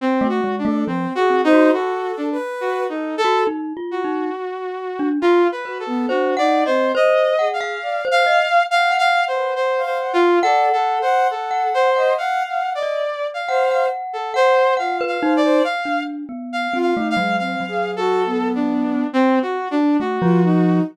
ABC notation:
X:1
M:6/4
L:1/16
Q:1/4=69
K:none
V:1 name="Lead 2 (sawtooth)"
(3C2 ^F2 D2 (3C2 F2 ^D2 F2 =D z (3F2 ^D2 A2 z2 F6 | (3F2 B2 A2 (3^F2 d2 c2 (3^d4 =f4 f4 (3f2 f2 c2 (3c2 c2 =F2 | (3A2 A2 c2 A2 c2 (3f4 d4 f4 z A c2 (3f2 f2 d2 | f2 z2 (3f2 f2 f2 (3f4 A4 D4 (3C2 ^F2 D2 F4 |]
V:2 name="Glockenspiel"
z A, ^G, A, F, z C ^F2 z6 F (3^D2 =F2 D2 z3 =D | F z B2 (3c2 ^f2 ^d2 c2 f =f2 c d z2 ^f7 | ^f3 z2 f2 f4 d3 f f3 f2 f B ^D2 | z D2 B,2 C A, ^F,2 F,7 z4 A, =F,3 |]
V:3 name="Ocarina"
z ^F z A (3c2 ^G2 c2 (3A4 B4 A4 z8 | z2 ^F B, (3D2 ^D2 C2 z2 ^G2 =d z3 ^f2 z B z =f ^f z | (3d2 ^f2 f2 f3 ^d (3f2 f2 d2 z2 c2 z4 =F2 c c | z5 F ^D ^G, (3C2 ^G2 ^F2 B,4 z2 F =D z =F ^D2 |]